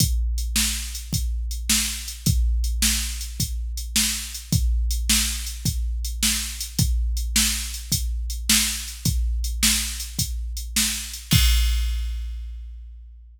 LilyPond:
\new DrumStaff \drummode { \time 12/8 \tempo 4. = 106 <hh bd>4 hh8 sn4 hh8 <hh bd>4 hh8 sn4 hh8 | <hh bd>4 hh8 sn4 hh8 <hh bd>4 hh8 sn4 hh8 | <hh bd>4 hh8 sn4 hh8 <hh bd>4 hh8 sn4 hh8 | <hh bd>4 hh8 sn4 hh8 <hh bd>4 hh8 sn4 hh8 |
<hh bd>4 hh8 sn4 hh8 <hh bd>4 hh8 sn4 hh8 | <cymc bd>4. r4. r4. r4. | }